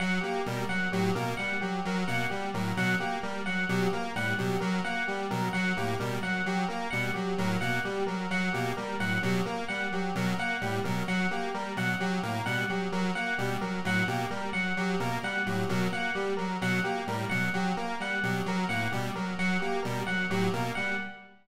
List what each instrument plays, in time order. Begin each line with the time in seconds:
0.00 lead 1 (square) F#3, electric piano 1 F#5
0.21 lead 1 (square) A#3, electric piano 1 G4
0.46 lead 1 (square) B2 G3, electric piano 1 A#4
0.69 lead 1 (square) F#3, electric piano 1 F#5
0.92 lead 1 (square) A2 F#3, electric piano 1 G4
1.15 lead 1 (square) B2 A#3, electric piano 1 A#4
1.37 lead 1 (square) G3, electric piano 1 F#5
1.61 lead 1 (square) F#3, electric piano 1 G4
1.85 lead 1 (square) F#3, electric piano 1 A#4
2.07 lead 1 (square) B2 A#3, electric piano 1 F#5
2.30 lead 1 (square) G3, electric piano 1 G4
2.54 lead 1 (square) A2 F#3, electric piano 1 A#4
2.77 lead 1 (square) B2 F#3, electric piano 1 F#5
3.00 lead 1 (square) A#3, electric piano 1 G4
3.23 lead 1 (square) G3, electric piano 1 A#4
3.46 lead 1 (square) F#3, electric piano 1 F#5
3.69 lead 1 (square) B2 F#3, electric piano 1 G4
3.93 lead 1 (square) A#3, electric piano 1 A#4
4.15 lead 1 (square) A2 G3, electric piano 1 F#5
4.38 lead 1 (square) B2 F#3, electric piano 1 G4
4.60 lead 1 (square) F#3, electric piano 1 A#4
4.85 lead 1 (square) A#3, electric piano 1 F#5
5.07 lead 1 (square) G3, electric piano 1 G4
5.30 lead 1 (square) B2 F#3, electric piano 1 A#4
5.53 lead 1 (square) F#3, electric piano 1 F#5
5.76 lead 1 (square) A2 A#3, electric piano 1 G4
6.00 lead 1 (square) B2 G3, electric piano 1 A#4
6.23 lead 1 (square) F#3, electric piano 1 F#5
6.46 lead 1 (square) F#3, electric piano 1 G4
6.68 lead 1 (square) A#3, electric piano 1 A#4
6.90 lead 1 (square) B2 G3, electric piano 1 F#5
7.14 lead 1 (square) F#3, electric piano 1 G4
7.38 lead 1 (square) A2 F#3, electric piano 1 A#4
7.61 lead 1 (square) B2 A#3, electric piano 1 F#5
7.85 lead 1 (square) G3, electric piano 1 G4
8.07 lead 1 (square) F#3, electric piano 1 A#4
8.30 lead 1 (square) F#3, electric piano 1 F#5
8.53 lead 1 (square) B2 A#3, electric piano 1 G4
8.77 lead 1 (square) G3, electric piano 1 A#4
9.00 lead 1 (square) A2 F#3, electric piano 1 F#5
9.23 lead 1 (square) B2 F#3, electric piano 1 G4
9.46 lead 1 (square) A#3, electric piano 1 A#4
9.68 lead 1 (square) G3, electric piano 1 F#5
9.92 lead 1 (square) F#3, electric piano 1 G4
10.15 lead 1 (square) B2 F#3, electric piano 1 A#4
10.38 lead 1 (square) A#3, electric piano 1 F#5
10.61 lead 1 (square) A2 G3, electric piano 1 G4
10.84 lead 1 (square) B2 F#3, electric piano 1 A#4
11.08 lead 1 (square) F#3, electric piano 1 F#5
11.31 lead 1 (square) A#3, electric piano 1 G4
11.54 lead 1 (square) G3, electric piano 1 A#4
11.76 lead 1 (square) B2 F#3, electric piano 1 F#5
12.00 lead 1 (square) F#3, electric piano 1 G4
12.23 lead 1 (square) A2 A#3, electric piano 1 A#4
12.46 lead 1 (square) B2 G3, electric piano 1 F#5
12.69 lead 1 (square) F#3, electric piano 1 G4
12.92 lead 1 (square) F#3, electric piano 1 A#4
13.15 lead 1 (square) A#3, electric piano 1 F#5
13.38 lead 1 (square) B2 G3, electric piano 1 G4
13.61 lead 1 (square) F#3, electric piano 1 A#4
13.85 lead 1 (square) A2 F#3, electric piano 1 F#5
14.08 lead 1 (square) B2 A#3, electric piano 1 G4
14.31 lead 1 (square) G3, electric piano 1 A#4
14.53 lead 1 (square) F#3, electric piano 1 F#5
14.77 lead 1 (square) F#3, electric piano 1 G4
15.00 lead 1 (square) B2 A#3, electric piano 1 A#4
15.23 lead 1 (square) G3, electric piano 1 F#5
15.46 lead 1 (square) A2 F#3, electric piano 1 G4
15.69 lead 1 (square) B2 F#3, electric piano 1 A#4
15.92 lead 1 (square) A#3, electric piano 1 F#5
16.15 lead 1 (square) G3, electric piano 1 G4
16.37 lead 1 (square) F#3, electric piano 1 A#4
16.61 lead 1 (square) B2 F#3, electric piano 1 F#5
16.84 lead 1 (square) A#3, electric piano 1 G4
17.07 lead 1 (square) A2 G3, electric piano 1 A#4
17.30 lead 1 (square) B2 F#3, electric piano 1 F#5
17.54 lead 1 (square) F#3, electric piano 1 G4
17.77 lead 1 (square) A#3, electric piano 1 A#4
18.00 lead 1 (square) G3, electric piano 1 F#5
18.23 lead 1 (square) B2 F#3, electric piano 1 G4
18.46 lead 1 (square) F#3, electric piano 1 A#4
18.69 lead 1 (square) A2 A#3, electric piano 1 F#5
18.92 lead 1 (square) B2 G3, electric piano 1 G4
19.15 lead 1 (square) F#3, electric piano 1 A#4
19.39 lead 1 (square) F#3, electric piano 1 F#5
19.60 lead 1 (square) A#3, electric piano 1 G4
19.83 lead 1 (square) B2 G3, electric piano 1 A#4
20.07 lead 1 (square) F#3, electric piano 1 F#5
20.30 lead 1 (square) A2 F#3, electric piano 1 G4
20.53 lead 1 (square) B2 A#3, electric piano 1 A#4
20.75 lead 1 (square) G3, electric piano 1 F#5